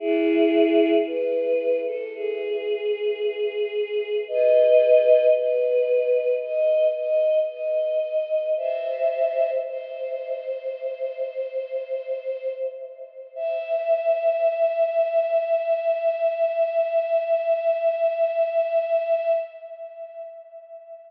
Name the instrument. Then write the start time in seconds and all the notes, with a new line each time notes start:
choir aahs
0.00 E4 G#4
1.07 B4
1.86 A4
2.15 G#4
4.28 B4 D#5
5.36 B4
6.42 D#5
6.95 D#5
7.49 D#5
8.57 C5 E5
9.66 C5
13.35 E5